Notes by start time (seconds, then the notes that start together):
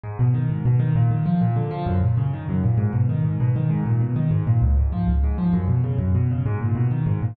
0.03 G#2
0.19 B2
0.34 D#3
0.50 G#2
0.65 B2
0.79 D#3
0.95 A#2
1.11 D#3
1.26 F3
1.41 A#2
1.56 D3
1.71 F3
1.86 F#2
2.03 A#2
2.17 C#3
2.33 D#3
2.49 F#2
2.64 A#2
2.78 G#2
2.93 B2
3.09 D#3
3.25 G#2
3.40 B2
3.56 D#3
3.70 G#2
3.86 A#2
4.01 B2
4.16 D#3
4.31 G#2
4.47 A#2
4.62 C#2
4.77 G#2
4.92 F3
5.07 C#2
5.24 G#2
5.38 F3
5.53 F#2
5.68 B2
5.84 C#3
5.99 F#2
6.15 B2
6.31 C#3
6.46 G#2
6.61 A#2
6.75 B2
6.91 D#3
7.06 G#2
7.22 A#2